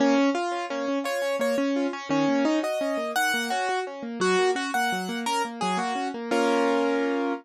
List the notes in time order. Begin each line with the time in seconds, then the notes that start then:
0.00 A#3 C#4
0.18 C#4
0.35 F4
0.52 C#4
0.70 A#3 C#4
0.88 C#4
1.04 F4 C#5
1.22 C#4
1.39 A#3 C#5
1.58 C#4
1.76 F4
1.93 C#4
2.09 D#3 C#4
2.28 A#3
2.45 C#4 D#4
2.63 F#4 D#5
2.81 C#4
2.97 A#3
3.16 D#3 F#5
3.34 A#3
3.50 C#4 F#4
3.69 F#4
3.87 C#4
4.03 A#3
4.20 F#3 F#4
4.39 A#3
4.55 C#4 F#4
4.74 A#3 F#5
4.92 F#3
5.09 A#3
5.26 C#4 A#4
5.45 A#3
5.61 F#3 G#4
5.77 A#3 F#4
5.95 C#4
6.14 A#3
6.31 A#3 C#4 F4 A#4